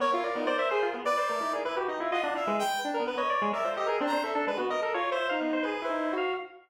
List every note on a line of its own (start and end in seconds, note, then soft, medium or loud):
0.00 0.11 B3 medium
0.00 0.95 A#4 medium
0.00 0.11 C#5 loud
0.12 0.22 E4 medium
0.12 0.24 F4 loud
0.23 0.34 A#4 medium
0.23 0.34 D5 medium
0.35 0.46 B3 medium
0.35 0.47 D#4 medium
0.46 0.57 C5 loud
0.46 0.57 D5 loud
0.58 0.69 C5 medium
0.58 0.69 E5 loud
0.71 0.87 G#4 loud
0.71 0.81 C5 loud
0.83 0.93 F4 loud
0.94 1.05 B3 medium
1.05 1.17 B4 loud
1.05 1.53 D5 loud
1.05 1.16 D5 loud
1.17 1.28 C5 medium
1.17 1.27 D5 medium
1.28 1.40 A3 medium
1.28 1.39 A#4 medium
1.40 1.52 D#4 medium
1.40 1.51 E4 medium
1.53 1.64 G#4 medium
1.53 1.63 A#4 soft
1.65 1.76 E4 medium
1.65 1.76 B4 loud
1.76 1.87 F#4 medium
1.76 1.87 G4 medium
1.88 1.99 D#4 medium
1.88 1.99 D#5 medium
2.00 2.11 E4 medium
2.00 2.11 F4 medium
2.11 2.22 F4 loud
2.11 2.23 D#5 loud
2.11 2.34 F#5 medium
2.23 2.34 D4 medium
2.23 2.35 D4 medium
2.35 2.45 E4 medium
2.35 2.57 E5 medium
2.35 2.46 F5 medium
2.47 2.63 G#3 loud
2.47 2.79 B4 medium
2.59 2.80 G5 loud
2.84 2.95 D4 medium
2.94 3.04 A#4 medium
3.00 3.15 B3 medium
3.07 3.18 B4 medium
3.17 3.49 C#5 medium
3.17 3.28 D#5 medium
3.30 3.40 D5 loud
3.42 3.52 G#3 loud
3.53 3.64 A#4 medium
3.53 3.64 D5 medium
3.53 3.69 E5 medium
3.64 3.75 F4 medium
3.64 3.74 C5 medium
3.71 4.03 A4 soft
3.77 3.87 G4 medium
3.77 3.87 D#5 medium
3.86 3.99 G#4 medium
3.86 3.97 A#4 medium
4.00 4.11 C4 loud
4.00 4.11 D4 loud
4.07 4.23 A#5 loud
4.12 4.23 D4 medium
4.12 4.23 C5 medium
4.23 4.34 A4 medium
4.23 4.34 E5 medium
4.35 4.46 D4 loud
4.35 4.46 A4 loud
4.47 4.57 G#3 medium
4.47 4.58 B4 loud
4.57 4.69 B3 medium
4.57 4.68 F#4 medium
4.70 4.81 A#4 medium
4.70 4.81 D#5 loud
4.81 4.92 A4 medium
4.81 4.93 A#4 medium
4.94 5.10 F4 medium
4.94 5.10 C#5 loud
5.11 5.27 C5 loud
5.11 5.28 E5 medium
5.29 5.63 D#4 medium
5.29 5.40 F5 loud
5.41 5.52 B3 medium
5.53 5.64 C5 loud
5.63 5.81 G#4 medium
5.63 5.84 B4 medium
5.82 6.14 E4 medium
5.82 6.14 C5 medium
5.89 6.10 D#4 medium
6.13 6.34 F#4 medium
6.17 6.33 F5 medium